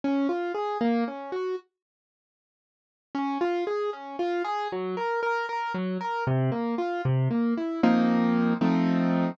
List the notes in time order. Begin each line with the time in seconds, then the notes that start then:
0.04 C#4
0.29 F4
0.54 G#4
0.81 A#3
1.08 C#4
1.32 F#4
3.15 C#4
3.41 F4
3.67 G#4
3.93 C#4
4.19 F4
4.44 G#4
4.72 F#3
4.97 A#4
5.23 A#4
5.49 A#4
5.74 F#3
6.01 A#4
6.27 C3
6.52 A#3
6.78 F4
7.05 C3
7.31 A#3
7.57 E4
7.83 F3 A#3 C4 D#4
8.61 F3 A3 C4 D#4